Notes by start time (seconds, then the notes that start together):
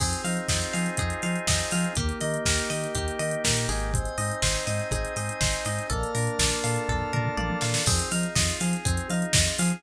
0.00 F2 C4 D#4 F4 G#4, kick, crash
0.13 closed hi-hat
0.24 F3 D#4 F5, open hi-hat
0.37 closed hi-hat
0.48 F2 F4 D#5, kick, snare
0.61 closed hi-hat
0.73 F3 G#4 F5, open hi-hat
0.86 closed hi-hat
0.97 F2 C4 G#4, kick, closed hi-hat
1.10 closed hi-hat
1.22 F3 D#4 F5, open hi-hat
1.36 closed hi-hat
1.47 F2 F4 D#5, kick, snare
1.60 closed hi-hat
1.71 F3 G#4 F5, open hi-hat
1.84 closed hi-hat
1.95 D#2 A#3 D#4 G4, kick, closed hi-hat
2.09 closed hi-hat
2.20 D#3 D#4 D#5, open hi-hat
2.34 closed hi-hat
2.45 D#2 G4 A#4, kick, snare
2.58 closed hi-hat
2.70 D#3 A#3 D#5, open hi-hat
2.84 closed hi-hat
2.95 D#2 D#4 G4, kick, closed hi-hat
3.08 closed hi-hat
3.19 D#3 G4 D#5, open hi-hat
3.31 closed hi-hat
3.44 A#2 A#3 A#4, kick, snare
3.57 closed hi-hat
3.69 G#1 D#4 G#4, open hi-hat
3.80 closed hi-hat
3.93 C4 C5 D#5 G#5, kick, closed hi-hat
4.05 closed hi-hat
4.18 G#2 D#4 D#5, open hi-hat
4.31 closed hi-hat
4.42 G#1 G#4 C5, kick, snare
4.56 closed hi-hat
4.67 G#2 C4 D#5, open hi-hat
4.79 closed hi-hat
4.91 G#1 D#4 G#4, kick, closed hi-hat
5.05 closed hi-hat
5.16 G#2 G#4 D#5, open hi-hat
5.29 closed hi-hat
5.41 G#1 C4 C5, kick, snare
5.53 closed hi-hat
5.65 G#2 D#4 D#5, open hi-hat
5.78 closed hi-hat
5.90 A#1 A#3 A4 A#4 D5 F5 A5, kick, closed hi-hat
6.03 closed hi-hat
6.15 A#2 D4 A#4, open hi-hat
6.27 closed hi-hat
6.39 A#1 F4 D5, kick, snare
6.51 closed hi-hat
6.64 A#2 A4 F5, open hi-hat
6.76 closed hi-hat
6.89 A#1 A#3 A4, kick, floor tom
7.01 floor tom
7.13 A#2 D4 A#4, mid tom
7.25 mid tom
7.37 A#1 F4 D5, high tom
7.50 high tom
7.61 A#2 A4 F5, snare
7.74 snare
7.86 F2 C4 D#4 F4 G#4, kick, crash
7.99 closed hi-hat
8.11 F3 D#4 F5, open hi-hat
8.23 closed hi-hat
8.35 F2 F4 D#5, kick, snare
8.50 closed hi-hat
8.60 F3 G#4 F5, open hi-hat
8.73 closed hi-hat
8.85 F2 C4 G#4, kick, closed hi-hat
8.97 closed hi-hat
9.10 F3 D#4 F5, open hi-hat
9.22 closed hi-hat
9.33 F2 F4 D#5, kick, snare
9.47 closed hi-hat
9.58 F3 G#4 F5, open hi-hat
9.70 closed hi-hat